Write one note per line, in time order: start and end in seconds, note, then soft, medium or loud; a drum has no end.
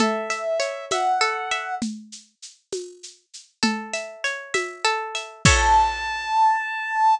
0.00 1.20 A4 loud
0.00 0.85 E5 medium
0.00 low conga medium
0.00 shaker medium
0.30 0.91 E5 medium
0.30 shaker medium
0.60 1.75 C#5 medium
0.60 shaker medium
0.91 1.51 E5 medium
0.91 1.75 F#5 medium
0.91 tambourine medium
0.91 high conga medium
0.91 shaker medium
1.21 1.79 A4 loud
1.21 shaker medium
1.51 1.80 E5 medium
1.51 shaker medium
1.82 low conga medium
1.82 shaker medium
2.12 shaker medium
2.42 shaker medium
2.72 tambourine medium
2.72 high conga medium
2.72 shaker medium
3.03 shaker medium
3.34 shaker medium
3.63 4.84 A4 loud
3.63 low conga medium
3.63 shaker medium
3.93 4.54 E5 medium
3.93 shaker medium
4.24 5.39 C#5 medium
4.24 shaker medium
4.54 5.14 E5 medium
4.54 tambourine medium
4.54 high conga medium
4.54 shaker medium
4.85 5.42 A4 loud
4.85 shaker medium
5.15 5.44 E5 medium
5.15 shaker medium
5.45 7.15 A4 loud
5.45 7.15 C#5 loud
5.45 7.15 E5 loud
5.45 7.14 A5 loud
5.45 kick loud
5.45 crash loud